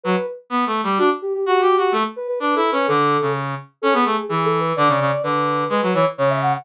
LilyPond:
<<
  \new Staff \with { instrumentName = "Ocarina" } { \time 2/4 \key d \major \tempo 4 = 127 b'8 r4. | fis'16 r16 g'16 g'16 \tuplet 3/2 { g'8 fis'8 g'8 } | a'16 r16 b'16 b'16 \tuplet 3/2 { b'8 a'8 b'8 } | a'4 r4 |
\key a \major a'16 gis'8. \tuplet 3/2 { gis'8 a'8 b'8 } | d''4 b'4 | b'8 cis''16 r16 cis''16 e''16 fis''16 fis''16 | }
  \new Staff \with { instrumentName = "Brass Section" } { \time 2/4 \key d \major fis16 r8. \tuplet 3/2 { b8 a8 g8 } | d'16 r8. \tuplet 3/2 { fis'8 g'8 fis'8 } | a16 r8. \tuplet 3/2 { d'8 e'8 cis'8 } | d8. cis8. r8 |
\key a \major cis'16 b16 a16 r16 e4 | d16 cis16 cis16 r16 d4 | gis16 fis16 e16 r16 cis4 | }
>>